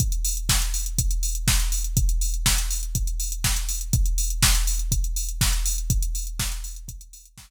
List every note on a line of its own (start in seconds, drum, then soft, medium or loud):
0.00 kick medium
0.00 closed hi-hat medium
0.12 closed hi-hat medium
0.25 open hi-hat medium
0.37 closed hi-hat medium
0.49 kick medium
0.49 snare medium
0.62 closed hi-hat medium
0.74 open hi-hat medium
0.86 closed hi-hat medium
0.98 kick medium
0.98 closed hi-hat medium
1.11 closed hi-hat medium
1.23 open hi-hat medium
1.35 closed hi-hat medium
1.48 kick medium
1.48 snare medium
1.60 closed hi-hat medium
1.72 open hi-hat medium
1.84 closed hi-hat medium
1.97 kick medium
1.97 closed hi-hat medium
2.09 closed hi-hat medium
2.21 open hi-hat medium
2.34 closed hi-hat medium
2.46 kick medium
2.46 snare medium
2.58 closed hi-hat medium
2.71 open hi-hat medium
2.83 closed hi-hat medium
2.95 kick medium
2.95 closed hi-hat medium
3.07 closed hi-hat medium
3.20 open hi-hat medium
3.32 closed hi-hat medium
3.44 kick medium
3.44 snare medium
3.56 closed hi-hat medium
3.69 open hi-hat medium
3.81 closed hi-hat medium
3.93 kick medium
3.93 closed hi-hat medium
4.06 closed hi-hat medium
4.18 open hi-hat medium
4.30 closed hi-hat medium
4.43 kick medium
4.43 snare loud
4.55 closed hi-hat medium
4.67 open hi-hat medium
4.79 closed hi-hat medium
4.92 kick medium
4.92 closed hi-hat medium
5.04 closed hi-hat medium
5.16 open hi-hat medium
5.29 closed hi-hat medium
5.41 kick medium
5.41 snare medium
5.53 closed hi-hat medium
5.66 open hi-hat medium
5.78 closed hi-hat medium
5.90 kick medium
5.90 closed hi-hat medium
6.02 closed hi-hat medium
6.15 open hi-hat medium
6.27 closed hi-hat medium
6.39 kick medium
6.39 snare medium
6.52 closed hi-hat medium
6.64 open hi-hat medium
6.76 closed hi-hat medium
6.88 kick medium
6.88 closed hi-hat medium
7.01 closed hi-hat medium
7.13 open hi-hat medium
7.25 closed hi-hat medium
7.37 kick medium
7.37 snare medium